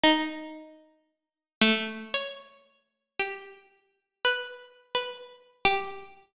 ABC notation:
X:1
M:2/4
L:1/8
Q:1/4=57
K:none
V:1 name="Harpsichord"
^D3 A, | ^c2 G2 | (3B2 B2 G2 |]